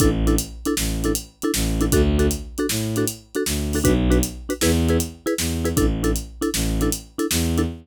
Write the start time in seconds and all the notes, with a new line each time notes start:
0.00 A1 D4 E4 A4, kick, closed hi-hat
0.27 D4 E4 A4, closed hi-hat
0.38 closed hi-hat
0.65 D4 E4 A4, closed hi-hat
0.77 A1, snare
1.04 D4 E4 A4, closed hi-hat
1.15 closed hi-hat
1.42 D4 E4 A4, closed hi-hat
1.54 A1, snare
1.81 D4 E4 A4, closed hi-hat
1.92 D2 D4 F#4 A4, kick, closed hi-hat
2.19 D4 F#4 A4, closed hi-hat
2.31 closed hi-hat
2.58 D4 F#4 A4, closed hi-hat
2.69 A2, snare
2.96 D4 F#4 A4, closed hi-hat
3.08 closed hi-hat
3.35 D4 F#4 A4, closed hi-hat
3.46 D2, snare
3.73 D4 F#4 A4, open hi-hat
3.84 B1 D4 F#4 B4, kick, closed hi-hat
4.10 D4 F#4 B4, closed hi-hat
4.23 closed hi-hat
4.49 D4 F#4 B4, closed hi-hat
4.61 E2 E4 G#4 B4, snare
4.89 E4 G#4 B4, closed hi-hat
5.00 closed hi-hat
5.26 E4 G#4 B4, closed hi-hat
5.38 E2, snare
5.65 E4 G#4 B4, closed hi-hat
5.77 A1 D4 E4 A4, kick, closed hi-hat
6.03 D4 E4 A4, closed hi-hat
6.16 closed hi-hat
6.41 D4 E4 A4, closed hi-hat
6.54 A1, snare
6.81 D4 E4 A4, closed hi-hat
6.92 closed hi-hat
7.18 D4 E4 A4, closed hi-hat
7.31 E2, snare
7.57 D4 E4 A4, closed hi-hat